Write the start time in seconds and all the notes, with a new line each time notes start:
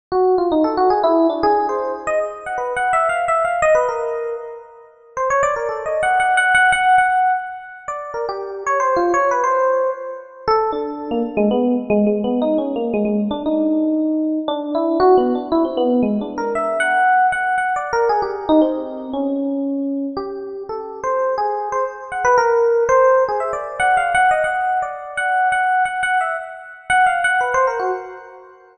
0.12 F#4
0.38 F4
0.52 D#4
0.64 A4
0.77 F#4
0.90 G#4
1.04 E4
1.30 D4
1.43 G#4
1.69 C5
2.07 D#5
2.46 F#5
2.58 B4
2.77 F#5
2.93 E5
3.09 F5
3.28 E5
3.45 F5
3.62 D#5
3.75 B4
3.89 A#4
5.17 C5
5.30 C#5
5.43 D5
5.56 A#4
5.69 A4
5.86 D#5
6.03 F#5
6.20 F#5
6.37 F#5
6.55 F#5
6.72 F#5
6.98 F#5
7.88 D5
8.14 A#4
8.29 G4
8.66 C#5
8.80 C5
8.96 F4
9.14 C#5
9.31 B4
9.44 C5
10.48 A4
10.72 D4
11.11 A#3
11.37 G#3
11.51 B3
11.90 G#3
12.07 G#3
12.24 B3
12.42 D#4
12.58 C#4
12.76 A#3
12.94 G#3
13.05 G#3
13.31 D4
13.46 D#4
14.48 D4
14.75 E4
15.00 F#4
15.17 B3
15.35 D4
15.52 E4
15.65 C4
15.77 B3
16.03 G#3
16.21 D4
16.38 A#4
16.55 E5
16.80 F#5
17.32 F#5
17.58 F#5
17.76 D5
17.93 A#4
18.09 G#4
18.22 G4
18.49 D#4
18.62 C4
19.13 C#4
20.17 G4
20.69 A4
21.04 C5
21.38 G#4
21.72 C5
22.12 F#5
22.25 B4
22.38 A#4
22.89 C5
23.28 G#4
23.40 E5
23.53 D5
23.80 F#5
23.97 F5
24.15 F#5
24.31 D#5
24.44 F#5
24.82 D5
25.17 F#5
25.52 F#5
25.85 F#5
26.03 F#5
26.21 E5
26.90 F#5
27.06 F5
27.24 F#5
27.41 B4
27.54 C5
27.67 A#4
27.80 F#4